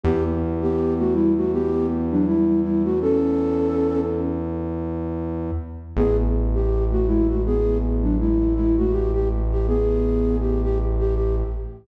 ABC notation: X:1
M:4/4
L:1/16
Q:"Swing 16ths" 1/4=81
K:Edor
V:1 name="Flute"
[B,G] z2 [B,G]2 [A,F] [G,E] [A,F] [B,G]2 z [F,D] [G,E]2 [G,E] [A,F] | [CA]6 z10 | [B,^G] z2 =G2 [A,F] [^G,E] [A,F] [B,^G]2 z [F,D] [G,E]2 [G,E] [A,F] | G G z G [B,^G]4 =G G z G G z3 |]
V:2 name="Synth Bass 1" clef=bass
E,,16- | E,,16 | A,,,16- | A,,,16 |]